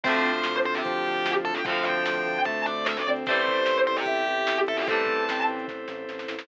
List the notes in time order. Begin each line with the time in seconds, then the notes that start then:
0.04 D2 F3 A3 C4 D4 F4 A4 C5, kick, crash
0.09 D3
0.15 closed hi-hat
0.24 D2, closed hi-hat
0.36 closed hi-hat
0.44 D2, snare
0.55 closed hi-hat
0.64 D2 C5, closed hi-hat
0.75 G4, closed hi-hat
0.84 D2 F3, kick, closed hi-hat
0.95 closed hi-hat
1.05 D2, closed hi-hat
1.15 closed hi-hat
1.25 D2, snare
1.35 closed hi-hat
1.44 D2 A4, closed hi-hat
1.55 G5, closed hi-hat
1.65 D2 F3 C4 D4 A4 C5 F5, kick, closed hi-hat
1.69 D3 F3 A3
1.77 closed hi-hat
1.85 D2 G5, closed hi-hat
1.95 closed hi-hat
2.06 D2, snare
2.16 closed hi-hat
2.26 D2, closed hi-hat
2.36 closed hi-hat
2.45 D2 A3 A5, kick, closed hi-hat
2.56 closed hi-hat
2.66 D2 D5, closed hi-hat
2.76 closed hi-hat
2.86 D2 E5, snare
2.96 D5, closed hi-hat
3.05 D2 C4, closed hi-hat
3.16 closed hi-hat
3.26 A1 G3 A3 C4 E4 G4 A4 C5, kick, closed hi-hat
3.32 E3
3.37 closed hi-hat
3.47 A1, kick, closed hi-hat
3.57 closed hi-hat
3.66 A1, snare
3.76 closed hi-hat
3.87 A1 C5, closed hi-hat
3.96 G4, closed hi-hat
4.06 A1 E5, kick, closed hi-hat
4.16 closed hi-hat
4.27 A1, closed hi-hat
4.38 closed hi-hat
4.47 A1, snare
4.58 closed hi-hat
4.67 A1 A4 E5, closed hi-hat
4.77 G4, closed hi-hat
4.87 A1 G3 A3 C4 E4 A4 C5 A5, kick, closed hi-hat
4.92 E3
4.97 closed hi-hat
5.06 A1, kick, closed hi-hat
5.17 closed hi-hat
5.28 A1 C4, snare
5.38 closed hi-hat
5.47 A1, closed hi-hat
5.59 closed hi-hat
5.68 A1, kick, snare
5.88 A1, snare
6.08 A1, snare
6.19 snare
6.28 A1, snare
6.39 snare